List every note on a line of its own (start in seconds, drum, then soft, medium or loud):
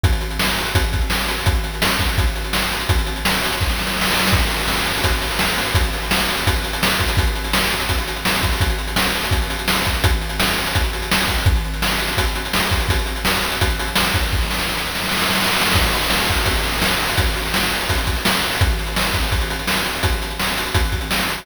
0.03 kick loud
0.03 closed hi-hat loud
0.13 closed hi-hat medium
0.21 closed hi-hat medium
0.31 closed hi-hat medium
0.39 snare loud
0.49 closed hi-hat medium
0.58 closed hi-hat medium
0.65 closed hi-hat medium
0.75 kick loud
0.75 closed hi-hat loud
0.84 closed hi-hat medium
0.93 kick medium
0.93 closed hi-hat medium
1.01 closed hi-hat medium
1.10 snare loud
1.19 closed hi-hat medium
1.28 closed hi-hat medium
1.38 open hi-hat medium
1.46 kick loud
1.46 closed hi-hat loud
1.55 closed hi-hat medium
1.64 closed hi-hat medium
1.74 closed hi-hat medium
1.82 snare loud
1.91 closed hi-hat medium
1.99 kick medium
1.99 closed hi-hat medium
2.09 closed hi-hat medium
2.18 kick loud
2.18 closed hi-hat loud
2.27 closed hi-hat medium
2.36 closed hi-hat medium
2.44 closed hi-hat medium
2.53 snare loud
2.62 closed hi-hat medium
2.72 closed hi-hat medium
2.80 closed hi-hat medium
2.89 kick loud
2.89 closed hi-hat loud
2.98 closed hi-hat medium
3.06 closed hi-hat medium
3.16 closed hi-hat medium
3.25 snare loud
3.34 closed hi-hat medium
3.43 closed hi-hat loud
3.52 closed hi-hat medium
3.61 kick medium
3.61 snare medium
3.69 snare medium
3.79 snare medium
3.87 snare medium
3.96 snare medium
4.01 snare loud
4.05 snare medium
4.10 snare loud
4.14 snare medium
4.19 snare loud
4.23 snare medium
4.27 snare loud
4.33 kick loud
4.33 crash loud
4.40 closed hi-hat medium
4.50 closed hi-hat medium
4.60 closed hi-hat medium
4.68 snare loud
4.77 closed hi-hat medium
4.85 closed hi-hat medium
4.94 closed hi-hat medium
5.04 kick medium
5.04 closed hi-hat loud
5.12 closed hi-hat medium
5.22 closed hi-hat medium
5.31 closed hi-hat medium
5.39 snare loud
5.48 closed hi-hat medium
5.58 closed hi-hat medium
5.66 closed hi-hat medium
5.75 kick loud
5.75 closed hi-hat loud
5.84 closed hi-hat medium
5.93 closed hi-hat medium
6.02 closed hi-hat medium
6.11 snare loud
6.20 closed hi-hat medium
6.29 closed hi-hat medium
6.37 closed hi-hat medium
6.47 kick loud
6.47 closed hi-hat loud
6.56 closed hi-hat medium
6.64 closed hi-hat medium
6.73 closed hi-hat medium
6.83 snare loud
6.91 closed hi-hat medium
6.99 kick medium
6.99 closed hi-hat medium
7.08 closed hi-hat loud
7.17 kick loud
7.17 closed hi-hat loud
7.27 closed hi-hat medium
7.35 closed hi-hat medium
7.44 closed hi-hat medium
7.53 snare loud
7.62 closed hi-hat medium
7.71 closed hi-hat medium
7.80 closed hi-hat medium
7.89 kick medium
7.89 closed hi-hat loud
7.99 closed hi-hat medium
8.08 closed hi-hat medium
8.16 closed hi-hat medium
8.25 snare loud
8.34 closed hi-hat medium
8.43 kick medium
8.43 closed hi-hat medium
8.52 open hi-hat medium
8.60 kick loud
8.60 closed hi-hat loud
8.70 closed hi-hat medium
8.78 closed hi-hat medium
8.88 closed hi-hat medium
8.96 snare loud
9.06 closed hi-hat medium
9.15 closed hi-hat medium
9.24 closed hi-hat medium
9.31 kick medium
9.31 closed hi-hat loud
9.42 closed hi-hat medium
9.50 closed hi-hat medium
9.59 closed hi-hat medium
9.68 snare loud
9.76 closed hi-hat medium
9.85 kick medium
9.85 closed hi-hat medium
9.94 closed hi-hat medium
10.04 kick loud
10.04 closed hi-hat loud
10.13 closed hi-hat medium
10.21 closed hi-hat medium
10.29 closed hi-hat medium
10.40 snare loud
10.48 closed hi-hat medium
10.57 closed hi-hat medium
10.66 closed hi-hat medium
10.75 kick medium
10.75 closed hi-hat loud
10.83 closed hi-hat medium
10.93 closed hi-hat medium
11.02 closed hi-hat medium
11.12 snare loud
11.20 closed hi-hat medium
11.28 kick medium
11.28 closed hi-hat medium
11.38 closed hi-hat medium
11.46 kick loud
11.46 closed hi-hat loud
11.56 closed hi-hat medium
11.65 closed hi-hat medium
11.74 closed hi-hat medium
11.82 snare loud
11.91 closed hi-hat medium
11.99 closed hi-hat medium
12.08 closed hi-hat medium
12.17 kick medium
12.17 closed hi-hat loud
12.27 closed hi-hat medium
12.35 closed hi-hat medium
12.45 closed hi-hat medium
12.53 snare loud
12.63 closed hi-hat medium
12.71 kick medium
12.71 closed hi-hat medium
12.80 closed hi-hat medium
12.89 kick loud
12.89 closed hi-hat loud
12.99 closed hi-hat medium
13.06 closed hi-hat medium
13.16 closed hi-hat medium
13.25 snare loud
13.35 closed hi-hat medium
13.43 closed hi-hat medium
13.52 closed hi-hat medium
13.61 kick medium
13.61 closed hi-hat loud
13.70 closed hi-hat medium
13.79 closed hi-hat loud
13.87 closed hi-hat medium
13.96 snare loud
14.05 closed hi-hat medium
14.14 kick medium
14.14 closed hi-hat medium
14.23 closed hi-hat medium
14.32 kick medium
14.32 snare medium
14.42 snare medium
14.50 snare medium
14.59 snare medium
14.69 snare medium
14.77 snare medium
14.86 snare medium
14.95 snare medium
15.04 snare medium
15.09 snare medium
15.12 snare medium
15.17 snare medium
15.21 snare medium
15.26 snare medium
15.30 snare medium
15.35 snare loud
15.40 snare medium
15.44 snare loud
15.47 snare medium
15.53 snare medium
15.57 snare medium
15.61 snare loud
15.66 snare loud
15.72 kick loud
15.72 snare loud
15.76 crash loud
15.84 closed hi-hat medium
15.93 closed hi-hat medium
16.02 closed hi-hat medium
16.10 snare loud
16.20 closed hi-hat medium
16.29 kick medium
16.29 closed hi-hat medium
16.37 closed hi-hat medium
16.46 kick medium
16.46 closed hi-hat loud
16.55 closed hi-hat medium
16.64 closed hi-hat medium
16.73 closed hi-hat medium
16.82 snare loud
16.91 closed hi-hat medium
17.00 closed hi-hat medium
17.09 closed hi-hat medium
17.18 kick loud
17.18 closed hi-hat loud
17.26 closed hi-hat medium
17.36 closed hi-hat medium
17.45 closed hi-hat medium
17.54 snare loud
17.63 closed hi-hat medium
17.72 closed hi-hat medium
17.81 closed hi-hat medium
17.89 kick medium
17.89 closed hi-hat loud
17.98 closed hi-hat medium
18.07 kick medium
18.07 closed hi-hat medium
18.16 closed hi-hat medium
18.25 snare loud
18.34 closed hi-hat medium
18.43 closed hi-hat medium
18.52 open hi-hat medium
18.61 kick loud
18.61 closed hi-hat loud
18.70 closed hi-hat medium
18.79 closed hi-hat medium
18.87 closed hi-hat medium
18.96 snare loud
19.06 closed hi-hat medium
19.14 kick medium
19.14 closed hi-hat medium
19.23 closed hi-hat medium
19.32 kick medium
19.32 closed hi-hat medium
19.41 closed hi-hat medium
19.50 closed hi-hat medium
19.59 closed hi-hat medium
19.67 snare loud
19.77 closed hi-hat medium
19.85 closed hi-hat medium
19.95 open hi-hat medium
20.03 kick medium
20.03 closed hi-hat loud
20.12 closed hi-hat medium
20.22 closed hi-hat medium
20.30 closed hi-hat medium
20.40 snare loud
20.48 closed hi-hat medium
20.57 closed hi-hat medium
20.66 closed hi-hat medium
20.74 kick loud
20.74 closed hi-hat loud
20.85 closed hi-hat medium
20.92 kick medium
20.92 closed hi-hat medium
21.01 closed hi-hat medium
21.11 snare loud
21.20 closed hi-hat medium
21.29 closed hi-hat medium
21.38 open hi-hat medium